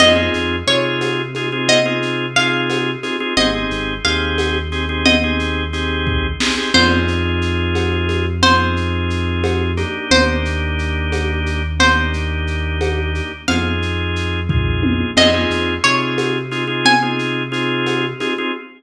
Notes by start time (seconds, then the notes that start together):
0.00 F2 C4 D#4 F4 G#4 D#5, crash, cowbell, low conga, shaker
0.16 C4 D#4 F4 G#4
0.34 F2, shaker
0.67 C3 C4 D#4 F4 G#4 C#5, shaker
1.01 cowbell, high conga, shaker
1.35 C4 D#4 F4 G#4, high conga, shaker
1.52 C4 D#4 F4 G#4
1.69 D#5, cowbell, low conga, shaker
1.86 C4 D#4 F4 G#4
2.02 shaker
2.36 C4 D#4 F4 G#4 F5, shaker
2.70 cowbell, high conga, shaker
3.03 C4 D#4 F4 G#4, high conga, shaker
3.20 C4 D#4 F4 G#4
3.37 G#1 C4 D#4 G4 G#4 D#5, cowbell, low conga, shaker
3.54 C4 D#4 G4 G#4
3.70 G#1, shaker
4.04 D#2 C4 D#4 G4 G#4 F5, shaker
4.38 cowbell, high conga, shaker
4.72 C4 D#4 G4 G#4, shaker
4.89 C4 D#4 G4 G#4
5.05 D#5, cowbell, low conga, shaker
5.24 C4 D#4 G4 G#4
5.39 shaker
5.73 C4 D#4 G4 G#4, shaker
6.07 kick
6.40 C4 D#4 G4 G#4, snare
6.57 C4 D#4 G4 G#4
6.74 F2 C4 D#4 F4 G#4 C5, crash, cowbell, low conga, shaker
7.08 shaker
7.42 shaker
7.75 cowbell, high conga, shaker
8.09 high conga, shaker
8.43 C4 D#4 F4 G#4 C5, cowbell, low conga, shaker
8.77 shaker
9.10 shaker
9.44 cowbell, high conga, shaker
9.77 A#3 D4 D#4 G4, high conga, shaker
10.11 D#2 C5, cowbell, low conga, shaker
10.45 shaker
10.79 shaker
11.12 cowbell, high conga, shaker
11.46 shaker
11.80 A#3 D4 D#4 G4 C5, cowbell, low conga, shaker
12.13 shaker
12.47 shaker
12.81 cowbell, high conga, shaker
13.15 shaker
13.48 F2 C4 D#4 F4 G#4 F5, cowbell, low conga, shaker
13.82 shaker
14.16 shaker
14.49 C4 D#4 F4 G#4, kick, floor tom
14.83 high tom
15.16 F2 C4 D#4 F4 G#4 D#5, crash, cowbell, low conga, shaker
15.34 C4 D#4 F4 G#4
15.50 F2, shaker
15.84 C3 C4 D#4 F4 G#4 C#5, shaker
16.18 cowbell, high conga, shaker
16.51 C4 D#4 F4 G#4, shaker
16.67 C4 D#4 F4 G#4
16.85 G#5, cowbell, low conga, shaker
17.02 C4 D#4 F4 G#4
17.19 shaker
17.52 C4 D#4 F4 G#4, shaker
17.86 cowbell, high conga, shaker
18.20 C4 D#4 F4 G#4, high conga, shaker
18.38 C4 D#4 F4 G#4